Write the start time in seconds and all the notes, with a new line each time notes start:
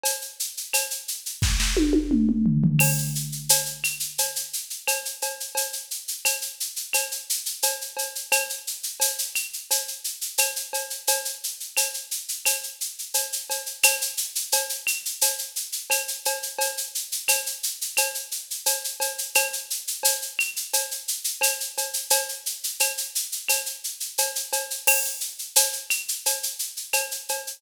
0.03 cowbell, shaker
0.21 shaker
0.40 shaker
0.57 shaker
0.73 cowbell, claves, shaker
0.91 shaker
1.08 shaker
1.26 shaker
1.42 kick, snare
1.60 snare
1.77 high tom
1.93 high tom
2.11 mid tom
2.29 mid tom
2.46 floor tom
2.64 floor tom
2.79 crash, cowbell, claves
2.98 shaker
3.15 shaker
3.32 shaker
3.49 cowbell, shaker
3.66 shaker
3.84 claves, shaker
4.00 shaker
4.18 cowbell, shaker
4.36 shaker
4.53 shaker
4.70 shaker
4.87 cowbell, claves, shaker
5.05 shaker
5.22 cowbell, shaker
5.40 shaker
5.55 cowbell, shaker
5.73 shaker
5.91 shaker
6.08 shaker
6.25 cowbell, claves, shaker
6.42 shaker
6.60 shaker
6.76 shaker
6.93 cowbell, claves, shaker
7.11 shaker
7.30 shaker
7.46 shaker
7.62 cowbell, shaker
7.81 shaker
7.97 cowbell, shaker
8.15 shaker
8.32 cowbell, claves, shaker
8.49 shaker
8.67 shaker
8.83 shaker
9.00 cowbell, shaker
9.19 shaker
9.35 claves, shaker
9.53 shaker
9.71 cowbell, shaker
9.88 shaker
10.04 shaker
10.21 shaker
10.38 cowbell, claves, shaker
10.56 shaker
10.73 cowbell, shaker
10.90 shaker
11.07 cowbell, shaker
11.25 shaker
11.44 shaker
11.60 shaker
11.77 cowbell, claves, shaker
11.94 shaker
12.11 shaker
12.28 shaker
12.46 cowbell, claves, shaker
12.63 shaker
12.81 shaker
12.99 shaker
13.14 cowbell, shaker
13.32 shaker
13.50 cowbell, shaker
13.66 shaker
13.83 cowbell, claves, shaker
14.01 shaker
14.17 shaker
14.35 shaker
14.52 cowbell, shaker
14.69 shaker
14.87 claves, shaker
15.05 shaker
15.21 cowbell, shaker
15.38 shaker
15.56 shaker
15.72 shaker
15.90 cowbell, claves, shaker
16.08 shaker
16.25 cowbell, shaker
16.43 shaker
16.58 cowbell, shaker
16.77 shaker
16.95 shaker
17.12 shaker
17.28 cowbell, claves, shaker
17.46 shaker
17.63 shaker
17.81 shaker
17.97 cowbell, claves, shaker
18.15 shaker
18.31 shaker
18.51 shaker
18.66 cowbell, shaker
18.84 shaker
19.00 cowbell, shaker
19.18 shaker
19.35 cowbell, claves, shaker
19.53 shaker
19.70 shaker
19.87 shaker
20.03 cowbell, shaker
20.22 shaker
20.39 claves, shaker
20.56 shaker
20.73 cowbell, shaker
20.91 shaker
21.08 shaker
21.24 shaker
21.41 cowbell, claves, shaker
21.60 shaker
21.77 cowbell, shaker
21.93 shaker
22.10 cowbell, shaker
22.29 shaker
22.46 shaker
22.64 shaker
22.80 cowbell, claves, shaker
22.98 shaker
23.15 shaker
23.32 shaker
23.49 cowbell, claves, shaker
23.66 shaker
23.84 shaker
24.00 shaker
24.18 cowbell, shaker
24.35 shaker
24.53 cowbell, shaker
24.70 shaker
24.87 crash, cowbell, claves
25.05 shaker
25.20 shaker
25.39 shaker
25.56 cowbell, shaker
25.73 shaker
25.90 claves, shaker
26.08 shaker
26.26 cowbell, shaker
26.43 shaker
26.59 shaker
26.77 shaker
26.93 cowbell, claves, shaker
27.11 shaker
27.29 cowbell, shaker
27.47 shaker